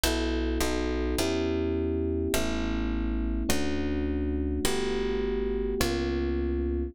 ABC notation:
X:1
M:4/4
L:1/8
Q:"Swing" 1/4=104
K:Edor
V:1 name="Electric Piano 1"
[B,EFA]2 [B,^DFA]2 [B,CEG]4 | [A,B,CE]4 [A,CDF]4 | [A,B,FG]4 [^A,B,C^E]4 |]
V:2 name="Electric Bass (finger)" clef=bass
B,,,2 B,,,2 E,,4 | A,,,4 D,,4 | G,,,4 C,,4 |]